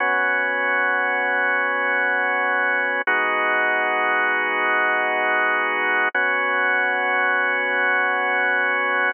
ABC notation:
X:1
M:4/4
L:1/8
Q:1/4=78
K:B
V:1 name="Drawbar Organ"
[B,CF]8 | [G,B,DF]8 | [B,CF]8 |]